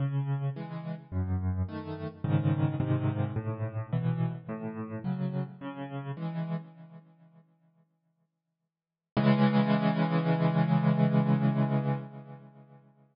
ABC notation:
X:1
M:4/4
L:1/8
Q:1/4=107
K:C#m
V:1 name="Acoustic Grand Piano"
C,2 [E,G,]2 F,,2 [D,A,]2 | [G,,C,D,]2 [G,,^B,,D,]2 A,,2 [=B,,E,]2 | A,,2 [C,F,]2 C,2 [E,G,]2 | "^rit." z8 |
[C,E,G,]8 |]